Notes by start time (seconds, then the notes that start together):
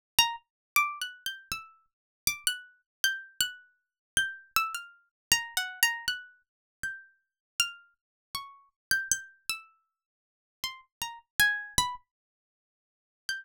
0.19 A#5
0.76 D6
1.02 F#6
1.26 G6
1.52 E6
2.27 D6
2.47 F#6
3.04 G6
3.41 F#6
4.17 G6
4.56 E6
4.75 F6
5.32 A#5
5.57 F#5
5.83 A#5
6.08 F#6
6.83 G6
7.60 F6
8.35 C#6
8.91 G6
9.12 G6
9.50 E6
10.64 C6
11.02 A#5
11.40 G#5
11.78 B5
13.29 G6